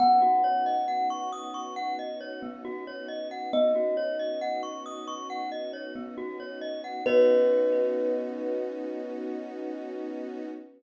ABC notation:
X:1
M:4/4
L:1/16
Q:1/4=68
K:B
V:1 name="Kalimba"
f16 | d6 z10 | B16 |]
V:2 name="Glockenspiel"
B, F c d f c' d' c' f d c B, F c d f | B, F c d f c' d' c' f d c B, F c d f | [B,Fcd]16 |]
V:3 name="String Ensemble 1"
[B,CDF]16 | [B,CDF]16 | [B,CDF]16 |]